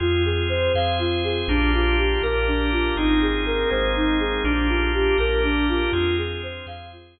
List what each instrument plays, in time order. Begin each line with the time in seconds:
0.00 synth bass 2 F2, drawbar organ C4 F4 G#4, ocarina F4
0.25 ocarina G#4
0.49 ocarina C5
0.74 synth bass 2 F2, drawbar organ C4 G#4 C5, ocarina F5
0.99 ocarina F4
1.24 ocarina G#4
1.48 synth bass 2 A#1, drawbar organ A#3 D4 F4 G4, ocarina D4
1.73 ocarina F4
1.98 ocarina G4
2.22 synth bass 2 A#1, drawbar organ A#3 D4 G4 A#4, ocarina A#4
2.47 ocarina D4
2.72 ocarina F4
2.96 synth bass 2 G#1, drawbar organ A#3 C4 D#4 G#4, ocarina D#4
3.21 ocarina G#4
3.46 ocarina A#4
3.70 synth bass 2 G#1, drawbar organ G#3 A#3 C4 G#4, ocarina C5
3.95 ocarina D#4
4.20 ocarina G#4
4.44 synth bass 2 A#1, drawbar organ A#3 D4 F4 G4, ocarina D4
4.68 ocarina F4
4.94 ocarina G4
5.18 synth bass 2 A#1, drawbar organ A#3 D4 G4 A#4, ocarina A#4
5.43 ocarina D4
5.68 ocarina F4
5.92 synth bass 2 F2, drawbar organ C4 F4 G#4, ocarina F4
6.17 ocarina G#4
6.43 ocarina C5
6.66 synth bass 2 F2, drawbar organ C4 G#4 C5, ocarina F5
6.92 ocarina F4
7.16 ocarina G#4